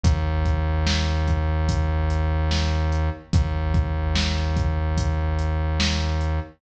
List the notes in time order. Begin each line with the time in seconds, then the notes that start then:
0.03 D#2, kick, closed hi-hat
0.45 kick, closed hi-hat
0.86 snare
1.28 kick, closed hi-hat
1.69 kick, closed hi-hat
2.10 closed hi-hat
2.51 snare
2.92 closed hi-hat
3.33 D#2, kick, closed hi-hat
3.74 kick, closed hi-hat
4.15 snare
4.57 kick, closed hi-hat
4.97 kick, closed hi-hat
5.39 closed hi-hat
5.80 snare
6.21 closed hi-hat